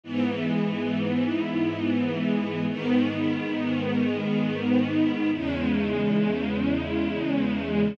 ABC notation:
X:1
M:3/4
L:1/8
Q:1/4=68
K:G#m
V:1 name="String Ensemble 1"
[G,,E,B,]6 | [G,,D,B,]6 | [E,,C,G,]6 |]